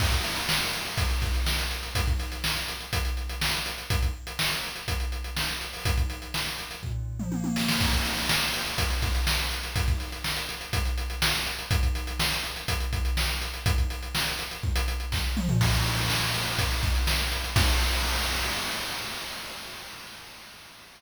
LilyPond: \new DrumStaff \drummode { \time 4/4 \tempo 4 = 123 <cymc bd>16 <hh bd>16 hh16 hh16 sn16 hh16 hh16 hh16 <hh bd>16 hh16 <hh bd>16 hh16 sn16 hh16 hh16 hh16 | <hh bd>16 <hh bd>16 hh16 hh16 sn16 hh16 hh16 hh16 <hh bd>16 hh16 hh16 hh16 sn16 hh16 hh16 hh16 | <hh bd>16 <hh bd>8 hh16 sn16 hh16 hh16 hh16 <hh bd>16 hh16 hh16 hh16 sn16 hh16 hh16 hho16 | <hh bd>16 <hh bd>16 hh16 hh16 sn16 hh16 hh16 hh16 <bd tomfh>8. toml16 tommh16 tommh16 sn16 sn16 |
<cymc bd>16 <hh bd>16 hh16 hh16 sn16 hh16 hh16 hh16 <hh bd>16 hh16 <hh bd>16 hh16 sn16 hh16 hh16 hh16 | <hh bd>16 <hh bd>16 hh16 hh16 sn16 hh16 hh16 hh16 <hh bd>16 hh16 hh16 hh16 sn16 hh16 hh16 hh16 | <hh bd>16 <hh bd>16 hh16 hh16 sn16 hh16 hh16 hh16 <hh bd>16 hh16 <hh bd>16 hh16 sn16 hh16 hh16 hh16 | <hh bd>16 <hh bd>16 hh16 hh16 sn16 hh16 hh16 hh16 bd16 hh16 hh16 hh16 <bd sn>8 toml16 tomfh16 |
<cymc bd>16 <hh bd>16 hh16 hh16 sn16 hh16 hh16 hh16 <hh bd>16 hh16 <hh bd>16 hh16 sn16 hh16 hh16 hh16 | <cymc bd>4 r4 r4 r4 | }